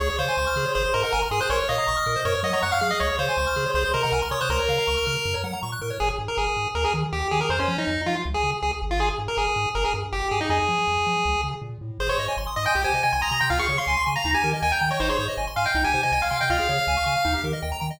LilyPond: <<
  \new Staff \with { instrumentName = "Lead 1 (square)" } { \time 4/4 \key des \major \tempo 4 = 160 des''8 c''4. c''8 bes'16 bes'16 bes'16 r16 aes'16 c''16 | des''8 ees''4. des''8 ees''16 des''16 ges''16 f''16 f''16 ees''16 | des''8 c''4. c''8 bes'16 bes'16 bes'16 r16 des''16 c''16 | bes'2~ bes'8 r4. |
\key aes \major aes'16 r8 bes'16 aes'4 bes'16 aes'16 r8 g'8 aes'16 bes'16 | c''16 des'8 ees'8. f'16 r8 aes'8 r16 aes'16 r8 f'16 | aes'16 r8 bes'16 aes'4 bes'16 aes'16 r8 g'8 aes'16 ees'16 | aes'2~ aes'8 r4. |
c''16 des''8 r8. ees''16 g''8 aes''8 aes''16 aes''16 bes''8 g''16 | f''16 des'''8 c'''8. r16 bes''8 aes''8 r16 aes''16 g''8 des''16 | c''16 des''8 r8. f''16 g''8 aes''8 aes''16 aes''16 f''8 g''16 | f''2~ f''8 r4. | }
  \new Staff \with { instrumentName = "Lead 1 (square)" } { \time 4/4 \key des \major aes'16 des''16 f''16 aes''16 des'''16 f'''16 aes'16 des''16 aes'16 c''16 ees''16 ges''16 aes''16 c'''16 ees'''16 ges'''16 | bes'16 des''16 f''16 bes''16 des'''16 f'''16 bes'16 c''16 bes'16 des''16 ges''16 bes''16 des'''16 ges'''16 aes'8~ | aes'16 des''16 f''16 aes''16 des'''16 f'''16 aes'16 des''16 aes'16 c''16 ees''16 ges''16 aes''16 c'''16 ees'''16 ges'''16 | bes'16 des''16 f''16 bes''16 des'''16 f'''16 bes'8. des''16 ges''16 bes''16 des'''16 ges'''16 bes'16 des''16 |
\key aes \major r1 | r1 | r1 | r1 |
aes'16 c''16 ees''16 aes''16 c'''16 ees'''16 c'''16 aes''16 g'16 c''16 ees''16 g''16 c'''16 ees'''16 c'''16 g''16 | f'16 aes'16 des''16 f''16 aes''16 des'''16 aes''16 f''16 ees'16 g'16 bes'16 ees''16 g''16 bes''16 g''16 ees''16 | ees'16 aes'16 c''16 ees''16 aes''16 c'''16 aes''16 ees''16 ees'16 g'16 c''16 ees''16 g''16 c'''16 g''16 ees''16 | f'16 aes'16 des''16 f''16 aes''16 des'''16 aes''16 f''16 ees'16 g'16 bes'16 ees''16 g''16 bes''16 g''16 ees''16 | }
  \new Staff \with { instrumentName = "Synth Bass 1" } { \clef bass \time 4/4 \key des \major des,8 des8 des,8 des8 aes,,8 aes,8 aes,,8 aes,8 | bes,,8 bes,8 bes,,8 bes,8 ges,8 ges8 ges,8 ges8 | des,8 des8 des,8 des8 c,8 c8 c,8 c8 | des,8 des8 des,8 des8 ges,8 ges8 bes,8 a,8 |
\key aes \major aes,,8 aes,8 aes,,8 aes,8 ees,8 ees8 ees,8 ees8 | f,8 f8 f,8 f8 des,8 des8 des,8 aes,,8~ | aes,,8 aes,8 aes,,8 aes,8 g,,8 g,8 g,,8 g,8 | f,8 f8 f,8 f8 des,8 des8 bes,8 a,8 |
aes,,8 aes,8 aes,,8 aes,8 c,8 c8 c,8 c8 | des,8 des8 des,8 des8 ees,8 ees8 ees,8 ees8 | aes,,8 aes,8 aes,,8 aes,8 c,8 c8 c,8 c8 | des,8 des8 des,8 des8 ees,8 ees8 ees,8 ees8 | }
>>